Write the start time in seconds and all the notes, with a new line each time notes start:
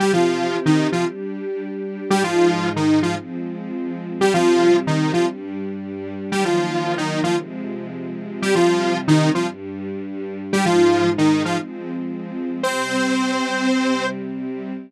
0.00 C3 G3 C4 G4
0.13 F3 F4
0.66 D#3 D#4
0.92 F3 F4
1.05 G3 D4 G4
2.10 G#2 G3 G#3 D#4 G4
2.24 F3 F4
2.76 D#3 D#4
3.03 F3 F4
3.16 F3 G#3 C4
4.21 C3 G3 C4 G4
4.34 F3 F4
4.87 D#3 D#4
5.13 F3 F4
5.27 G2 G3 D4
6.31 D#3 F#3 G3 A#3 G4
6.45 F3 F4
6.98 D#3 D#4
7.24 F3 F4
7.37 C3 F3 G#3
8.42 C3 G3 C4 G4
8.55 F3 F4
9.08 D#3 D#4
9.35 F3 F4
9.48 G2 G3 D4
10.53 G#2 G3 G#3 D#4 G4
10.66 F3 F4
11.18 D#3 D#4
11.45 F3 F4
11.58 F3 G#3 C4
12.63 C3 G3 C4 C5
13.68 C3 G3 C4